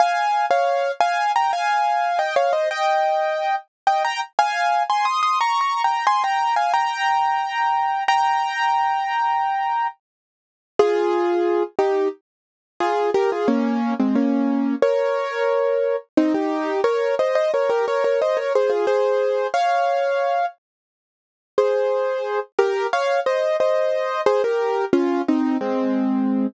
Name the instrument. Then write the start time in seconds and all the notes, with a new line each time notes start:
acoustic grand piano
0.00 F5 G#5
0.51 C#5 F5
1.00 F5 G#5
1.36 G5 A#5
1.53 F5 G#5
2.19 D#5 G5
2.36 C#5 F5
2.53 C5 D#5
2.71 D#5 G5
3.87 D#5 G5
4.04 G5 A#5
4.39 F5 G#5
4.90 G#5 C6
5.05 C6 D#6
5.23 C6 D#6
5.41 A#5 C#6
5.61 A#5 C#6
5.84 G5 A#5
6.07 G#5 C6
6.24 G5 A#5
6.56 F5 G#5
6.74 G5 A#5
8.08 G5 A#5
10.79 F4 G#4
11.79 D#4 G4
12.80 F4 G#4
13.14 G4 A#4
13.32 F4 G#4
13.48 A#3 C#4
14.00 G#3 C4
14.15 A#3 C#4
14.82 A#4 C#5
16.17 C4 D#4
16.34 D#4 G4
16.84 A#4 C#5
17.19 C5 D#5
17.35 C5 D#5
17.54 A#4 C#5
17.70 G4 A#4
17.88 A#4 C#5
18.04 A#4 C#5
18.22 C5 D#5
18.37 A#4 C#5
18.55 G#4 C5
18.70 F4 G#4
18.87 G#4 C5
19.54 C#5 F5
21.58 G#4 C5
22.59 G4 A#4
22.93 C#5 F5
23.26 C5 D#5
23.60 C5 D#5
24.26 G#4 C5
24.44 G4 A#4
24.93 C#4 F4
25.28 C4 D#4
25.61 G#3 C4